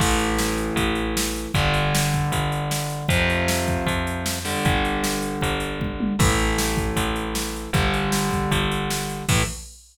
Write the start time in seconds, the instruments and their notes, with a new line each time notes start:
0.00 electric bass (finger) A1, overdriven guitar E3 A3, kick, crash
0.19 closed hi-hat
0.38 snare
0.58 closed hi-hat
0.76 electric bass (finger) A1, kick, closed hi-hat
0.95 closed hi-hat
1.17 snare
1.36 closed hi-hat
1.54 electric bass (finger) G1, overdriven guitar D3 G3, kick, closed hi-hat
1.74 closed hi-hat
1.95 snare
2.14 kick, closed hi-hat
2.32 electric bass (finger) G1, kick, closed hi-hat
2.52 closed hi-hat
2.71 snare
2.90 closed hi-hat
3.08 electric bass (finger) F2, overdriven guitar C3 F3, kick, closed hi-hat
3.30 closed hi-hat
3.48 snare
3.67 kick, closed hi-hat
3.86 electric bass (finger) F2, kick, closed hi-hat
4.07 closed hi-hat
4.26 snare
4.45 overdriven guitar D3 G3, open hi-hat
4.65 electric bass (finger) G1, kick, closed hi-hat
4.85 closed hi-hat
5.04 snare
5.22 closed hi-hat
5.41 electric bass (finger) G1, kick, closed hi-hat
5.60 closed hi-hat
5.80 kick, high tom
6.00 high tom
6.19 electric bass (finger) A1, overdriven guitar E3 A3, kick, crash
6.38 closed hi-hat
6.58 snare
6.77 kick, closed hi-hat
6.96 electric bass (finger) A1, kick, closed hi-hat
7.16 closed hi-hat
7.35 snare
7.56 closed hi-hat
7.73 electric bass (finger) G1, overdriven guitar D3 G3, kick, closed hi-hat
7.94 closed hi-hat
8.12 snare
8.31 kick, closed hi-hat
8.51 electric bass (finger) G1, kick, closed hi-hat
8.71 closed hi-hat
8.90 snare
9.09 closed hi-hat
9.29 electric bass (finger) A2, overdriven guitar E3 A3, kick, crash